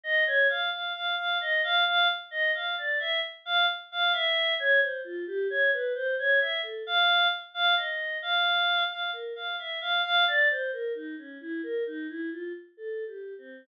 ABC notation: X:1
M:5/8
L:1/16
Q:1/4=66
K:none
V:1 name="Choir Aahs"
^d ^c f f f f d f f z | ^d f =d e z f z f e2 | ^c =c F G ^c B =c ^c e A | f2 z f ^d2 f3 f |
^A f e f f d c A ^D ^C | E ^A ^D E F z (3=A2 G2 C2 |]